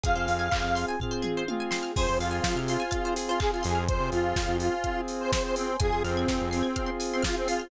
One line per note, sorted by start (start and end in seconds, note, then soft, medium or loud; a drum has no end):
0.04 0.15 F2 medium
0.04 1.94 C4 medium
0.04 0.47 C4 medium
0.04 1.94 F4 medium
0.04 0.47 F4 medium
0.04 0.14 G#4 medium
0.04 1.94 G#4 medium
0.04 0.47 G#4 medium
0.04 0.86 F5 loud
0.04 kick medium
0.04 closed hi-hat medium
0.16 0.27 F2 medium
0.16 0.27 C5 medium
0.28 0.50 F2 medium
0.28 0.40 F5 medium
0.28 open hi-hat medium
0.39 0.50 G#5 medium
0.52 0.63 F2 medium
0.52 0.96 C4 medium
0.52 0.96 F4 medium
0.52 0.96 G#4 medium
0.52 0.62 C6 medium
0.52 kick medium
0.52 clap loud
0.62 0.85 F2 medium
0.62 0.73 F6 medium
0.75 0.86 C6 medium
0.75 open hi-hat medium
0.89 0.99 G#5 medium
1.00 1.44 C4 medium
1.00 1.44 F4 medium
1.00 1.44 G#4 medium
1.00 1.12 F5 medium
1.00 kick medium
1.00 floor tom medium
1.11 1.22 C5 medium
1.22 1.33 G#4 medium
1.22 mid tom medium
1.37 1.48 C5 medium
1.48 1.92 C4 medium
1.48 1.92 F4 medium
1.48 1.92 G#4 medium
1.48 1.59 F5 medium
1.48 high tom medium
1.60 1.71 G#5 medium
1.71 1.82 C6 medium
1.71 snare medium
1.83 1.94 F6 medium
1.96 2.07 F2 medium
1.96 2.82 C4 medium
1.96 2.82 F4 medium
1.96 2.82 G#4 medium
1.96 2.08 G#4 medium
1.96 2.18 C5 loud
1.96 2.91 C5 medium
1.96 2.92 F5 medium
1.96 2.91 G#5 medium
1.96 kick medium
1.96 crash medium
2.07 2.19 F2 medium
2.07 2.18 C5 medium
2.19 2.41 F2 medium
2.19 2.59 F4 loud
2.19 2.31 F5 medium
2.19 open hi-hat medium
2.31 2.42 G#5 medium
2.44 2.54 F3 medium
2.44 2.55 C6 medium
2.44 kick medium
2.44 snare loud
2.56 2.77 C3 medium
2.56 2.68 F6 medium
2.68 3.14 F4 medium
2.68 2.81 C6 medium
2.68 open hi-hat medium
2.80 2.91 G#5 medium
2.91 3.78 C4 medium
2.91 3.78 F4 medium
2.91 3.78 G#4 medium
2.91 3.87 C5 medium
2.91 3.02 F5 medium
2.91 3.87 G#5 medium
2.91 3.87 C6 medium
2.91 kick medium
2.91 closed hi-hat medium
3.05 3.16 C5 medium
3.16 3.28 G#4 medium
3.16 open hi-hat medium
3.28 3.39 F4 medium
3.28 3.40 C5 medium
3.40 3.51 G#4 loud
3.40 3.51 F5 medium
3.40 kick medium
3.40 clap medium
3.52 3.63 F4 medium
3.52 3.65 G#5 medium
3.63 4.00 F2 medium
3.63 3.84 G#4 loud
3.63 3.74 C6 medium
3.63 open hi-hat medium
3.75 3.86 F6 medium
3.88 4.75 C4 medium
3.88 4.75 F4 medium
3.88 4.75 G#4 medium
3.88 4.10 C5 loud
3.88 4.83 C5 medium
3.88 4.83 F5 medium
3.88 4.83 G#5 medium
3.88 kick medium
3.88 closed hi-hat medium
4.00 4.11 C3 medium
4.12 4.34 F2 medium
4.12 4.57 F4 loud
4.12 open hi-hat medium
4.36 4.47 F2 medium
4.36 kick medium
4.36 snare loud
4.48 4.70 F2 medium
4.60 5.01 F4 loud
4.60 open hi-hat medium
4.84 5.71 C4 medium
4.84 5.71 F4 medium
4.84 5.71 G#4 medium
4.84 5.79 C5 medium
4.84 5.79 G#5 medium
4.84 5.79 C6 medium
4.84 kick medium
4.84 closed hi-hat medium
5.08 open hi-hat medium
5.20 5.31 C5 loud
5.32 5.43 C5 loud
5.32 kick medium
5.32 snare loud
5.44 5.55 C5 loud
5.56 5.77 C4 loud
5.56 open hi-hat medium
5.80 5.91 F2 medium
5.80 6.67 C4 medium
5.80 6.76 C4 medium
5.80 6.67 F4 medium
5.80 6.76 F4 medium
5.80 6.67 G#4 medium
5.80 6.03 G#4 loud
5.80 6.76 G#4 medium
5.80 5.90 G#5 medium
5.80 kick medium
5.80 closed hi-hat medium
5.92 6.03 F2 medium
5.92 6.03 C6 medium
6.04 6.26 F2 medium
6.04 6.49 C4 loud
6.04 6.15 F6 medium
6.04 open hi-hat medium
6.17 6.28 G#6 medium
6.28 6.39 F2 medium
6.28 6.41 C7 medium
6.28 kick medium
6.28 snare medium
6.39 6.63 F2 medium
6.39 6.50 F7 medium
6.51 6.91 C4 medium
6.51 6.62 C7 medium
6.51 open hi-hat medium
6.63 6.74 G#6 medium
6.76 7.63 C4 medium
6.76 7.70 C4 medium
6.76 7.63 F4 medium
6.76 7.63 G#4 medium
6.76 7.70 G#4 medium
6.76 7.70 C5 medium
6.76 6.87 F6 medium
6.76 kick medium
6.76 closed hi-hat medium
6.87 6.97 C6 medium
7.00 7.11 G#5 medium
7.00 open hi-hat medium
7.12 7.24 C4 loud
7.12 7.24 C6 medium
7.23 7.36 F4 loud
7.23 7.33 F6 medium
7.23 kick medium
7.23 snare loud
7.35 7.48 C4 loud
7.35 7.46 G#6 medium
7.47 7.68 F4 loud
7.47 7.59 C7 medium
7.47 open hi-hat medium
7.60 7.70 F7 medium